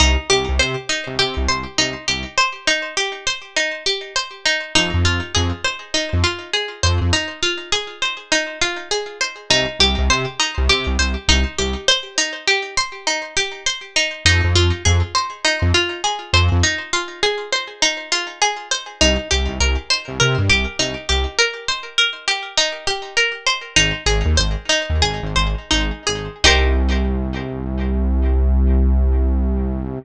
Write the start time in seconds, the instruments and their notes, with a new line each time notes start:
0.00 synth bass 1 C2, pizzicato strings D#4
0.30 synth bass 1 C2, pizzicato strings G4
0.49 synth bass 1 C2
0.59 synth bass 1 C3, pizzicato strings C5
0.89 pizzicato strings D#4
1.07 synth bass 1 C2
1.19 synth bass 1 C3, pizzicato strings G4
1.37 synth bass 1 C2
1.49 synth bass 1 C2, pizzicato strings C5
1.78 synth bass 1 C2, pizzicato strings D#4
2.08 synth bass 1 C2, pizzicato strings G4
2.38 pizzicato strings C5
2.67 pizzicato strings D#4
2.97 pizzicato strings G4
3.27 pizzicato strings C5
3.56 pizzicato strings D#4
3.86 pizzicato strings G4
4.16 pizzicato strings C5
4.46 pizzicato strings D#4
4.75 synth bass 1 F2, pizzicato strings D#4
4.94 synth bass 1 F2
5.04 synth bass 1 F2, pizzicato strings F4
5.35 synth bass 1 F2, pizzicato strings G#4
5.64 pizzicato strings C5
5.94 pizzicato strings D#4
6.13 synth bass 1 F2
6.24 pizzicato strings F4
6.53 pizzicato strings G#4
6.83 synth bass 1 F2, pizzicato strings C5
7.01 synth bass 1 F2
7.13 pizzicato strings D#4
7.43 pizzicato strings F4
7.72 pizzicato strings G#4
8.02 pizzicato strings C5
8.32 pizzicato strings D#4
8.62 pizzicato strings F4
8.91 pizzicato strings G#4
9.21 pizzicato strings C5
9.50 synth bass 1 C2, pizzicato strings D#4
9.79 synth bass 1 C2, pizzicato strings G4
9.98 synth bass 1 C2
10.10 synth bass 1 C3, pizzicato strings C5
10.40 pizzicato strings D#4
10.58 synth bass 1 C2
10.69 synth bass 1 C3, pizzicato strings G4
10.87 synth bass 1 C2
10.99 synth bass 1 C2, pizzicato strings C5
11.28 synth bass 1 C2, pizzicato strings D#4
11.58 synth bass 1 C2, pizzicato strings G4
11.88 pizzicato strings C5
12.18 pizzicato strings D#4
12.47 pizzicato strings G4
12.77 pizzicato strings C5
13.07 pizzicato strings D#4
13.37 pizzicato strings G4
13.66 pizzicato strings C5
13.96 pizzicato strings D#4
14.25 synth bass 1 F2, pizzicato strings D#4
14.44 synth bass 1 F2
14.55 synth bass 1 F2, pizzicato strings F4
14.85 synth bass 1 F2, pizzicato strings G#4
15.15 pizzicato strings C5
15.45 pizzicato strings D#4
15.62 synth bass 1 F2
15.74 pizzicato strings F4
16.04 pizzicato strings G#4
16.33 synth bass 1 F2, pizzicato strings C5
16.52 synth bass 1 F2
16.63 pizzicato strings D#4
16.93 pizzicato strings F4
17.23 pizzicato strings G#4
17.52 pizzicato strings C5
17.82 pizzicato strings D#4
18.12 pizzicato strings F4
18.42 pizzicato strings G#4
18.71 pizzicato strings C5
19.01 synth bass 1 C2, pizzicato strings D#4
19.31 synth bass 1 C2, pizzicato strings G4
19.48 synth bass 1 C2
19.60 synth bass 1 C2, pizzicato strings A#4
19.90 pizzicato strings C5
20.08 synth bass 1 C2
20.20 synth bass 1 C3, pizzicato strings A#4
20.38 synth bass 1 G2
20.49 synth bass 1 C2, pizzicato strings G4
20.79 synth bass 1 C2, pizzicato strings D#4
21.09 synth bass 1 C2, pizzicato strings G4
21.38 pizzicato strings A#4
21.68 pizzicato strings C5
21.98 pizzicato strings A#4
22.28 pizzicato strings G4
22.57 pizzicato strings D#4
22.87 pizzicato strings G4
23.17 pizzicato strings A#4
23.47 pizzicato strings C5
23.76 synth bass 1 G#1, pizzicato strings D#4
24.06 synth bass 1 G#1, pizzicato strings G#4
24.25 synth bass 1 D#2
24.37 synth bass 1 G#1, pizzicato strings C5
24.69 pizzicato strings D#4
24.90 synth bass 1 D#2
25.02 synth bass 1 G#1, pizzicato strings G#4
25.23 synth bass 1 G#1
25.36 synth bass 1 G#1, pizzicato strings C5
25.71 synth bass 1 G#1, pizzicato strings D#4
26.07 synth bass 1 G#1, pizzicato strings G#4
26.44 synth bass 1 C2, pizzicato strings D#4 G4 A#4 C5